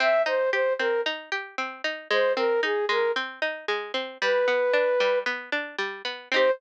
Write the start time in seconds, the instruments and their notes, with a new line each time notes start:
0.00 pizzicato strings C4, flute E5
0.26 pizzicato strings D#4, flute C5
0.52 pizzicato strings G4, flute C5
0.79 pizzicato strings C4, flute A#4
1.06 pizzicato strings D#4
1.32 pizzicato strings G4
1.58 pizzicato strings C4
1.84 pizzicato strings D#4
2.11 pizzicato strings G#3, flute C5
2.36 pizzicato strings C4, flute A#4
2.63 pizzicato strings D#4, flute G#4
2.89 pizzicato strings G#3, flute A#4
3.16 pizzicato strings C4
3.42 pizzicato strings D#4
3.68 pizzicato strings G#3
3.94 pizzicato strings C4
4.21 pizzicato strings G3, flute B4
4.48 pizzicato strings B3
4.73 pizzicato strings D4
5.00 pizzicato strings G3
5.26 pizzicato strings B3
5.52 pizzicato strings D4
5.79 pizzicato strings G3
6.05 pizzicato strings B3
6.32 pizzicato strings C4 D#4, flute C5
6.36 pizzicato strings G4